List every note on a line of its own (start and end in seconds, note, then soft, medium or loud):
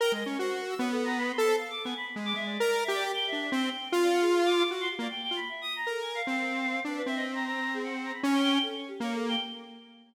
0.00 0.12 A#4 loud
0.00 0.12 G5 medium
0.12 0.24 G#3 medium
0.12 0.24 D#5 medium
0.26 0.38 C#4 medium
0.26 0.37 C#5 medium
0.39 0.74 F#4 medium
0.39 0.57 C5 medium
0.59 0.68 A#4 medium
0.69 0.78 E6 medium
0.78 1.32 B3 loud
0.78 0.90 C#5 medium
0.91 1.03 A4 loud
1.04 1.16 A#5 loud
1.18 1.30 B5 loud
1.31 1.42 C6 medium
1.38 1.56 A4 loud
1.44 1.56 C5 medium
1.58 1.69 F5 medium
1.70 1.82 D6 medium
1.84 1.94 B3 medium
1.84 1.96 G#5 medium
1.97 2.05 B5 loud
2.06 2.15 B5 medium
2.16 2.33 G#3 medium
2.25 2.34 D6 loud
2.34 2.58 G#3 medium
2.34 2.44 E5 loud
2.45 2.80 D5 medium
2.60 2.84 A#4 loud
2.84 2.92 E5 loud
2.88 3.12 G4 loud
2.94 3.03 D5 loud
3.04 3.13 G4 loud
3.14 3.26 G5 loud
3.27 3.39 E5 loud
3.32 3.50 D4 medium
3.40 3.51 E5 medium
3.52 3.70 C4 loud
3.52 3.89 G5 medium
3.92 4.63 F4 loud
4.02 4.11 D5 medium
4.11 4.20 F#5 medium
4.21 4.30 G#4 loud
4.32 4.43 G#4 medium
4.45 4.56 D6 medium
4.57 4.69 D6 loud
4.71 4.88 F#4 medium
4.80 4.89 C6 loud
4.90 4.99 G4 medium
4.99 5.08 A#3 medium
4.99 5.09 D5 medium
5.10 5.21 G5 medium
5.22 5.34 G5 medium
5.31 5.40 F4 medium
5.36 5.48 B5 loud
5.49 5.61 E5 medium
5.61 5.73 D#6 medium
5.76 5.88 A#5 loud
5.87 6.01 A4 medium
5.87 6.22 A#4 medium
6.01 6.13 G#5 medium
6.15 6.27 F5 loud
6.27 6.80 C4 medium
6.27 6.80 F5 loud
6.85 7.02 D4 medium
6.85 6.96 B4 medium
6.97 7.06 B4 loud
7.06 8.12 C4 medium
7.06 7.15 E5 loud
7.16 7.24 D#5 loud
7.35 7.44 A#5 loud
7.46 7.72 A#5 loud
7.74 7.83 G#4 loud
7.83 8.01 F#5 medium
8.04 8.13 A#5 medium
8.13 8.22 B5 medium
8.23 8.59 C#4 loud
8.33 8.42 G5 medium
8.42 8.51 G5 loud
8.53 8.62 G5 loud
8.62 8.74 A4 medium
8.76 8.87 C#5 medium
8.88 9.00 G4 medium
9.00 9.36 A#3 medium
9.00 9.14 C#5 medium
9.14 9.26 A4 medium
9.28 9.40 G5 loud